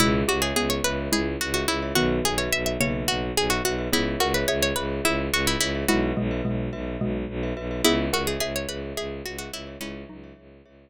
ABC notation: X:1
M:7/8
L:1/16
Q:1/4=107
K:C#dor
V:1 name="Pizzicato Strings"
E2 F G G c B2 G2 F F E2 | F2 G c e e c2 F2 G F F2 | E2 F B c c B2 E2 F E E2 | F8 z6 |
E2 F G G c B2 G2 F F E2 | C8 z6 |]
V:2 name="Xylophone"
[B,,G,]2 =G z [B,^G]4 [G,E]4 z2 | [D,B,]6 [C,A,]6 z2 | [B,G]2 [Af] z [Ge]4 [Ge]4 z2 | [G,E]2 [B,,G,] z [B,,G,]4 [B,,G,]4 z2 |
[B,G]2 [Af] z [Ge]4 [Ge]4 z2 | [G,E]2 [F,D]6 z6 |]
V:3 name="Glockenspiel"
[Gce]3 [Gce]3 [Gce]5 [Gce] [Gce] [Gce] | [FBe]3 [FBe]3 [FBe]5 [FBe] [FBe] [FBe] | [Gce]3 [Gce]3 [Gce]5 [Gce] [Gce] [Gce] | [FBe]3 [FBe]3 [FBe]5 [FBe] [FBe] [FBe] |
[Gce]3 [Gce]3 [Gce]5 [Gce] [Gce] [Gce] | [Gce]3 [Gce]3 [Gce]5 z3 |]
V:4 name="Violin" clef=bass
C,,2 C,,2 C,,2 C,,2 C,,2 C,,2 C,,2 | B,,,2 B,,,2 B,,,2 B,,,2 B,,,2 B,,,2 B,,,2 | C,,2 C,,2 C,,2 C,,2 C,,2 C,,2 C,,2 | B,,,2 B,,,2 B,,,2 B,,,2 B,,,2 B,,,2 B,,,2 |
C,,2 C,,2 C,,2 C,,2 C,,2 C,,2 C,,2 | C,,2 C,,2 C,,2 C,,2 z6 |]